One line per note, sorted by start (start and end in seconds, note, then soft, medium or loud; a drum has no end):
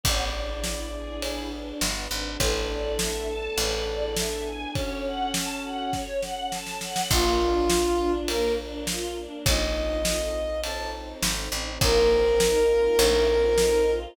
0.04 1.73 A1 loud
0.04 0.30 B3 medium
0.04 1.21 B3 medium
0.04 1.21 D4 medium
0.04 1.21 E4 medium
0.04 1.21 G#4 medium
0.04 1.21 D5 medium
0.04 kick medium
0.04 ride medium
0.33 0.60 D4 medium
0.64 0.90 E4 medium
0.64 snare medium
0.94 1.20 G#4 medium
1.22 2.38 B3 medium
1.22 2.38 D4 medium
1.22 1.49 E4 medium
1.22 1.48 G#4 medium
1.22 2.38 G#4 medium
1.22 2.38 B4 loud
1.22 ride medium
1.52 1.78 D4 medium
1.81 2.08 G1 medium
1.81 2.08 B3 medium
1.81 snare medium
2.11 2.37 G#1 medium
2.11 2.37 D4 medium
2.39 3.48 A1 medium
2.39 2.99 B3 medium
2.39 2.99 D4 medium
2.39 2.99 E4 medium
2.39 4.48 A4 medium
2.39 2.99 A4 medium
2.39 2.66 B4 medium
2.39 kick medium
2.39 ride medium
2.69 2.96 D5 medium
2.99 3.58 A3 medium
2.99 3.58 B3 medium
2.99 3.58 D4 medium
2.99 3.58 A4 medium
2.99 3.26 E5 medium
2.99 snare medium
3.28 3.55 A5 medium
3.58 4.66 A1 medium
3.58 4.16 B3 medium
3.58 4.16 D4 medium
3.58 4.17 E4 medium
3.58 4.16 G#4 medium
3.58 3.84 B4 medium
3.58 ride medium
3.87 4.13 D5 medium
4.17 4.75 B3 medium
4.17 4.75 D4 medium
4.17 4.75 G#4 medium
4.17 4.75 B4 medium
4.17 4.43 E5 medium
4.17 snare medium
4.45 4.71 G#5 medium
4.75 5.91 C#4 medium
4.75 5.93 C#4 medium
4.75 5.91 F#4 medium
4.75 5.91 A4 medium
4.75 5.03 C#5 medium
4.75 kick medium
4.75 ride medium
5.05 5.31 F#5 medium
5.34 5.61 A5 medium
5.34 snare medium
5.64 5.91 F#5 medium
5.93 7.10 C#4 medium
5.93 7.10 A4 medium
5.93 6.20 C#5 medium
5.93 7.10 C#5 medium
5.93 kick medium
5.93 snare medium
6.22 6.48 F#5 medium
6.22 snare medium
6.52 6.78 A5 medium
6.52 snare medium
6.67 snare medium
6.81 7.08 F#5 medium
6.81 snare medium
6.96 snare medium
7.11 9.27 A#1 loud
7.11 7.38 A#3 medium
7.11 8.27 D4 medium
7.11 8.12 F4 loud
7.11 8.28 F4 medium
7.11 8.27 A#4 medium
7.11 kick medium
7.11 crash medium
7.41 7.67 D4 medium
7.70 7.97 F4 medium
7.70 snare medium
7.99 8.26 D4 medium
8.27 9.44 A#3 medium
8.27 8.55 A#3 medium
8.27 9.44 D4 medium
8.27 8.53 A#4 loud
8.27 9.44 A#4 loud
8.27 ride medium
8.58 8.84 D4 medium
8.87 9.14 F4 medium
8.87 snare medium
9.15 9.42 D4 medium
9.46 11.14 A#1 loud
9.46 10.62 C4 medium
9.46 10.62 D#4 loud
9.46 10.62 F4 loud
9.46 10.62 A4 loud
9.46 10.61 D#5 loud
9.46 kick medium
9.46 ride medium
10.05 snare medium
10.63 11.80 C4 medium
10.63 11.80 D#4 medium
10.63 11.80 A4 medium
10.63 11.80 C5 medium
10.63 10.90 A5 loud
10.63 ride medium
11.23 11.49 G#1 medium
11.23 snare medium
11.52 11.78 A1 medium
11.81 12.89 A#1 medium
11.81 12.08 A#3 medium
11.81 12.40 C4 medium
11.81 12.40 D#4 medium
11.81 12.41 F4 medium
11.81 13.91 A#4 loud
11.81 12.40 A#4 medium
11.81 kick loud
11.81 ride medium
12.10 12.37 C4 medium
12.40 12.99 A#3 medium
12.40 12.99 C4 medium
12.40 12.66 D#4 medium
12.40 12.99 D#4 medium
12.40 12.99 A#4 loud
12.40 snare medium
12.69 12.96 F4 medium
12.99 14.07 A#1 loud
12.99 13.25 A3 medium
12.99 13.57 C4 loud
12.99 13.57 D#4 medium
12.99 13.58 F4 medium
12.99 13.57 A4 loud
12.99 ride medium
13.29 13.56 C4 soft
13.58 14.16 C4 medium
13.58 14.16 D#4 medium
13.58 13.85 D#4 medium
13.58 14.16 A4 medium
13.58 14.16 C5 medium
13.58 snare medium
13.87 14.13 F4 medium